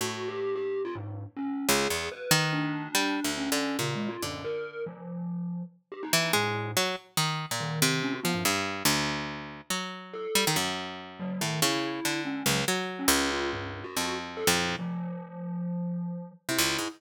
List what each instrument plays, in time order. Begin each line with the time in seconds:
0.01 orchestral harp A2, glockenspiel F#4
0.28 glockenspiel G4
0.56 glockenspiel G4
0.85 glockenspiel F4
0.95 glockenspiel G#2
1.37 glockenspiel C#4
1.69 orchestral harp C#2, glockenspiel G#4
1.90 orchestral harp E2
2.12 glockenspiel B4
2.31 orchestral harp D#3
2.53 glockenspiel D4
2.95 orchestral harp G3
3.24 orchestral harp D2
3.37 glockenspiel C#4
3.52 orchestral harp D3
3.79 orchestral harp A#2, glockenspiel C#3
3.95 glockenspiel G#3
4.09 glockenspiel F4
4.22 glockenspiel F#2, orchestral harp D3
4.44 glockenspiel A#4
4.86 glockenspiel F3
5.92 glockenspiel G4
6.03 glockenspiel D#4
6.13 orchestral harp E3
6.33 glockenspiel A2, orchestral harp G#3
6.77 orchestral harp F#3
7.17 orchestral harp D#3
7.51 orchestral harp A#2
7.60 glockenspiel D#3
7.82 orchestral harp C3
8.03 glockenspiel C#4
8.13 glockenspiel F#4
8.23 orchestral harp F3, glockenspiel B3
8.34 glockenspiel G2
8.45 orchestral harp G2
8.85 orchestral harp D2
9.70 orchestral harp F#3
10.14 glockenspiel A4
10.35 orchestral harp G3
10.47 orchestral harp D#3
10.56 orchestral harp F#2
11.20 glockenspiel F#3
11.41 orchestral harp A2, glockenspiel D#3
11.62 orchestral harp C#3, glockenspiel E4
12.05 orchestral harp D3
12.25 glockenspiel C#4
12.46 orchestral harp C#2, glockenspiel F#3
12.68 orchestral harp F#3
12.99 glockenspiel C#4
13.08 orchestral harp C#2
13.31 glockenspiel F4
13.53 glockenspiel G2
13.84 glockenspiel F#4
13.97 orchestral harp F2
14.37 glockenspiel A4
14.47 orchestral harp F2, glockenspiel A#2
14.79 glockenspiel F3
16.49 orchestral harp C3, glockenspiel E4
16.59 orchestral harp C#2
16.79 orchestral harp G#2